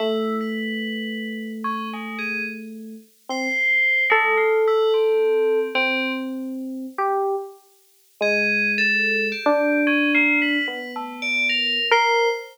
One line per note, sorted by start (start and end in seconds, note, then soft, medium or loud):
0.00 2.94 A3 medium
0.00 0.36 E4 medium
0.41 1.52 B4 medium
1.64 1.89 C#4 medium
1.93 2.18 G#3 medium
2.19 2.43 G#4 medium
3.29 3.48 C4 medium
3.29 4.04 C5 loud
4.10 4.35 G#3 loud
4.10 5.59 A4 loud
4.37 4.62 F4 medium
4.67 4.92 E4 loud
4.94 5.68 C4 medium
5.75 6.86 C4 medium
5.75 6.12 C4 loud
6.98 7.35 G4 medium
8.21 9.32 G#3 medium
8.21 8.71 G#4 loud
8.78 9.27 A4 loud
9.32 9.81 G4 medium
9.46 10.57 D4 loud
9.87 10.11 C#4 loud
10.15 10.39 A#3 loud
10.42 10.66 B4 loud
10.66 11.79 B3 medium
10.66 10.91 B4 medium
10.96 11.21 A3 medium
11.22 11.47 D5 loud
11.49 11.86 A#4 medium
11.91 12.28 A#4 loud
11.91 12.29 C5 loud